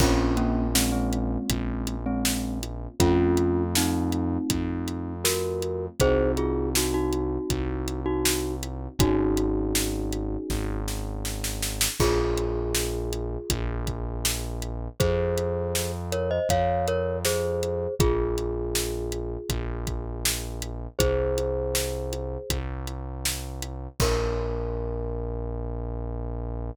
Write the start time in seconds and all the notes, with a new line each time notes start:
0.00 A#1 A#3 C4 C#4 F4, kick, crash
0.37 A#3 C#4, closed hi-hat
0.75 G#3 C4, snare
0.92 G#3 C4
1.13 closed hi-hat
1.50 A#1, kick, closed hi-hat
1.87 closed hi-hat
2.06 G#3 C4
2.25 snare
2.63 closed hi-hat
3.00 F2 A3 C4 C#4 F4, kick, closed hi-hat
3.37 closed hi-hat
3.75 C4 D#4, snare
4.12 closed hi-hat
4.50 F2, kick, closed hi-hat
4.88 closed hi-hat
5.24 F#4 A#4, snare
5.62 closed hi-hat
6.00 C2 C4 D#4 F#4 G#4 C5, kick, closed hi-hat
6.37 F4 G#4, closed hi-hat
6.75 D#4 F#4, snare
6.94 D#4 F#4
7.12 closed hi-hat
7.50 C2, kick, closed hi-hat
7.88 closed hi-hat
8.06 D#4 F#4
8.25 snare
8.63 closed hi-hat
8.99 G#1 C#4 D#4 F#4 G#4, kick, closed hi-hat
9.37 closed hi-hat
9.75 snare
10.12 closed hi-hat
10.50 G#1, kick, snare
10.88 snare
11.25 snare
11.44 snare
11.62 snare
11.81 snare
12.00 A#1 F4 G#4, kick, crash
12.38 closed hi-hat
12.75 snare
13.13 closed hi-hat
13.50 A#1, kick, closed hi-hat
13.87 kick, closed hi-hat
14.25 snare
14.62 closed hi-hat
15.00 F2 G#4 C5, kick, closed hi-hat
15.38 closed hi-hat
15.75 snare
16.12 A#4 C#5, closed hi-hat
16.31 C5 D#5
16.49 F2 C#5 F5, kick, closed hi-hat
16.88 A#4 C#5, closed hi-hat
17.25 G#4 C5, snare
17.63 closed hi-hat
17.99 A#1 F4 G#4, kick, closed hi-hat
18.38 closed hi-hat
18.75 snare
19.12 closed hi-hat
19.49 A#1, kick, closed hi-hat
19.87 kick, closed hi-hat
20.25 snare
20.62 closed hi-hat
20.99 C2 G#4 C5, kick, closed hi-hat
21.38 closed hi-hat
21.75 snare
22.13 closed hi-hat
22.50 C2, kick, closed hi-hat
22.87 closed hi-hat
23.25 snare
23.62 closed hi-hat
24.00 A#1 A#4, kick, crash